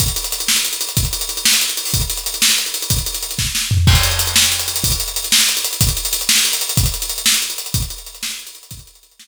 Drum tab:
CC |------------|------------|------------|------------|
HH |xxxxxx-xxxxx|xxxxxx-xxxxo|xxxxxx-xxxxx|xxxxxx------|
SD |------o-----|------o-----|------o-----|------o-o---|
FT |------------|------------|------------|----------o-|
BD |o-----------|o-----------|o-----------|o-----o-----|

CC |x-----------|------------|------------|------------|
HH |-xxxxx-xxxxx|xxxxxx-xxxxx|xxxxxx-xxxxx|xxxxxx-xxxxx|
SD |------o-----|------o-----|------o-----|------o-----|
FT |------------|------------|------------|------------|
BD |o-----------|o-----------|o-----------|o-----------|

CC |------------|------------|
HH |xxxxxx-xxxxx|xxxxxx------|
SD |------o-----|------o-----|
FT |------------|------------|
BD |o-----------|o-----------|